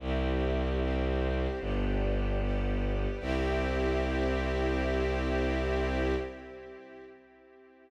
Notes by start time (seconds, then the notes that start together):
0.00 C2 C4 E4 G4
0.80 C4 G4 C5
1.60 G1 B3 D4 G4
2.40 G3 B3 G4
3.20 C2 C4 E4 G4